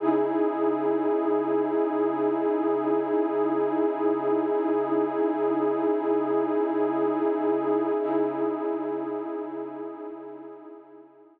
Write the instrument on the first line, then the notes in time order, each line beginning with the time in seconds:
pad 2 (warm)
0.00 C#3 D#4 E4 G#4
8.00 C#3 D#4 E4 G#4